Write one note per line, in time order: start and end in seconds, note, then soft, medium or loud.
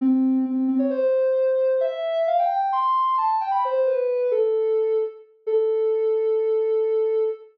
0.01 0.38 C4 loud
0.45 0.64 C4 loud
0.68 0.79 C4 loud
0.79 0.90 C#5 loud
0.90 1.77 C5 loud
1.81 2.20 E5 loud
2.27 2.38 F5 loud
2.39 2.49 G5 loud
2.50 2.70 G5 loud
2.72 3.15 C6 loud
3.18 3.36 A5 loud
3.41 3.51 G5 loud
3.51 3.62 B5 medium
3.65 3.87 C5 loud
3.86 4.27 B4 loud
4.31 4.98 A4 loud
5.46 7.23 A4 loud